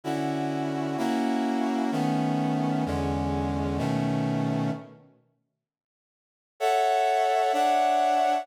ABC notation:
X:1
M:4/4
L:1/8
Q:"Swing" 1/4=128
K:A
V:1 name="Brass Section"
[D,CEF]4 | [^A,CEF]4 [^D,=A,B,C]4 | [E,,D,G,C]4 [B,,^D,A,C]4 | z8 |
[Acef]4 [Dcef]4 |]